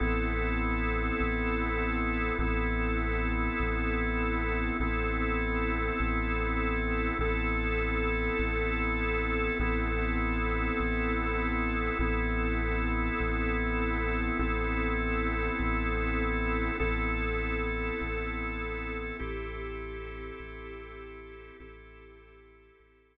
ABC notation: X:1
M:6/8
L:1/8
Q:3/8=50
K:Am
V:1 name="Drawbar Organ"
[B,CEA]6 | [B,CEA]6 | [B,CEA]6 | [B,CEA]6 |
[B,CEA]6 | [B,CEA]6 | [B,CEA]6 | [B,CEA]6 |
[CEGA]6 | [CEGA]6 |]
V:2 name="Synth Bass 2" clef=bass
A,,,3 A,,,3 | A,,,3 A,,,3 | A,,,3 A,,,3 | A,,,3 A,,,3 |
A,,,3 A,,,3 | A,,,3 A,,,3 | A,,,3 A,,,3 | A,,,3 A,,,3 |
A,,,3 A,,,3 | A,,,3 A,,,3 |]